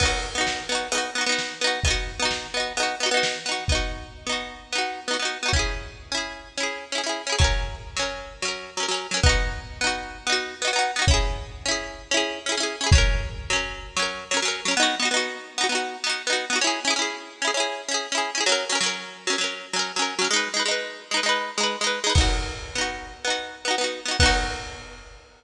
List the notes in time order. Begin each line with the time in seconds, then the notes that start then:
0.00 B3 D#4, kick, crash
0.05 F#4
0.35 B3 D#4
0.41 F#4
0.47 snare
0.69 B3 D#4
0.75 F#4
0.92 B3 D#4, closed hi-hat
0.98 F#4
1.15 B3 D#4
1.21 F#4
1.26 B3 D#4
1.32 F#4
1.39 snare
1.61 B3 D#4
1.67 F#4
1.84 B3 D#4, kick, closed hi-hat
1.90 F#4
2.20 B3 D#4
2.25 F#4
2.31 snare
2.54 B3 D#4
2.60 F#4
2.77 B3 D#4, closed hi-hat
2.83 F#4
3.00 B3 D#4
3.06 F#4
3.11 B3 D#4
3.17 F#4
3.23 snare
3.46 B3 D#4
3.52 F#4
3.68 B3 D#4, kick
3.75 F#4
4.27 B3 D#4
4.32 F#4
4.72 B3 D#4
4.78 F#4
5.08 B3 D#4
5.14 F#4
5.19 B3 D#4
5.25 F#4
5.43 B3 D#4
5.48 F#4
5.53 C#4 E4, kick
5.59 G#4
6.12 C#4 E4
6.17 G#4
6.57 C#4 E4
6.63 G#4
6.92 C#4 E4
6.98 G#4
7.04 C#4 E4
7.09 G#4
7.27 C#4 E4
7.32 G#4
7.38 F#3 C#4, kick
7.44 A#4
7.97 F#3 C#4
8.02 A#4
8.42 F#3 C#4
8.48 A#4
8.77 F#3 C#4
8.83 A#4
8.88 F#3 C#4
8.94 A#4
9.11 F#3 C#4
9.17 A#4
9.23 B3 D#4, kick
9.29 F#4
9.81 B3 D#4
9.87 F#4
10.27 B3 D#4
10.32 F#4
10.62 B3 D#4
10.67 F#4
10.73 B3 D#4
10.79 F#4
10.96 B3 D#4
11.02 F#4
11.07 C#4 E4, kick
11.14 G#4
11.66 C#4 E4
11.71 G#4
12.11 C#4 E4
12.17 G#4
12.46 C#4 E4
12.52 G#4
12.57 C#4 E4
12.63 G#4
12.81 C#4 E4
12.87 G#4
12.92 F#3 C#4, kick
12.98 A#4
13.50 F#3 C#4
13.56 A#4
13.97 F#3 C#4
14.02 A#4
14.31 F#3 C#4
14.37 A#4
14.42 F#3 C#4
14.48 A#4
14.65 F#3 C#4
14.71 A#4
14.77 B3 D#4
14.83 F#4
15.00 B3 D#4
15.05 F#4
15.11 B3 D#4
15.17 F#4
15.58 B3 D#4
15.64 F#4
15.69 B3 D#4
15.75 F#4
16.04 B3 D#4
16.10 F#4
16.27 B3 D#4
16.33 F#4
16.50 B3 D#4
16.56 F#4
16.61 C#4 E4
16.67 G#4
16.85 C#4 E4
16.90 G#4
16.96 C#4 E4
17.02 G#4
17.42 C#4 E4
17.47 G#4
17.54 C#4 E4
17.60 G#4
17.88 C#4 E4
17.94 G#4
18.12 C#4 E4
18.18 G#4
18.35 C#4 E4
18.41 G#4
18.46 F#3 C#4
18.52 A#4
18.69 F#3 C#4
18.75 A#4
18.81 F#3 C#4
18.86 A#4
19.27 F#3 C#4
19.33 A#4
19.38 F#3 C#4
19.44 A#4
19.73 F#3 C#4
19.79 A#4
19.96 F#3 C#4
20.02 A#4
20.19 F#3 C#4
20.24 A#4
20.31 G#3 D#4
20.36 B4
20.54 G#3 D#4
20.60 B4
20.65 G#3 D#4
20.71 B4
21.11 G#3 D#4
21.17 B4
21.23 G#3 D#4
21.29 B4
21.58 G#3 D#4
21.63 B4
21.81 G#3 D#4
21.87 B4
22.04 G#3 D#4
22.10 B4
22.15 B3 D#4, kick, crash
22.21 F#4
22.75 B3 D#4
22.81 F#4
23.24 B3 D#4
23.30 F#4
23.65 B3 D#4
23.71 F#4
23.78 B3 D#4
23.84 F#4
24.06 B3 D#4
24.11 F#4
24.20 B3 D#4, kick, crash
24.26 F#4